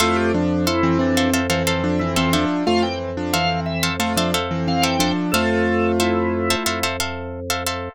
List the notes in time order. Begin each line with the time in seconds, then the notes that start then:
0.00 F2 A3 E4 F4 A4 C5 E5 F5
0.16 G4
0.34 F3 D4
0.66 E4 A4 C5 E5 F5
0.83 E3 C4
0.99 E3 C4 D4
1.17 A4 C5 E5 F5
1.33 A4 C5 E5 F5
1.50 E3 C4 A4 C5 E5 F5
1.67 A4 C5 E5 F5
1.84 F3 D4
1.99 E3 C4 E4
2.16 E3 C4 F4 A4 C5 E5 F5
2.33 F3 D4 A4 C5 E5 F5
2.67 F2 A3 F4 F5
2.83 E3 C4 G5
3.17 F3 D4
3.33 E3 C4 A4 C5 E5 F5
3.66 E5
3.83 A4 C5 E5 F5
4.00 A3 F4 A4 C5 E5 F5
4.17 F3 D4 A4 C5 E5 F5
4.34 A4 C5 E5 F5
4.51 E3 C4
4.68 E3 C4 F5
4.82 A4 C5 E5 F5 G5
4.99 F3 D4 A4 C5 E5 F5
5.32 F2 A3 F4 A4 C5 E5 F5
6.00 E4 A4 C5 E5 F5
6.50 A4 C5 E5 F5
6.66 F2 A4 C5 E5 F5
6.83 A4 C5 E5 F5
7.00 A4 C5 E5 F5
7.50 A4 C5 E5 F5
7.67 A4 C5 E5 F5